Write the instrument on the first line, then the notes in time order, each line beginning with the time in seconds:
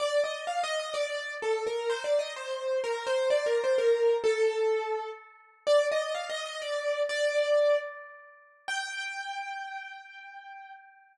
acoustic grand piano
0.00 D5
0.24 D#5
0.47 F5
0.63 D#5
0.80 D#5
0.94 D5
1.42 A4
1.67 A#4
1.90 C5
2.04 D5
2.19 D#5
2.36 C5
2.84 A#4
3.07 C5
3.30 D5
3.46 A#4
3.64 C5
3.78 A#4
4.24 A4
5.67 D5
5.92 D#5
6.15 F5
6.30 D#5
6.46 D#5
6.62 D5
7.09 D5
8.68 G5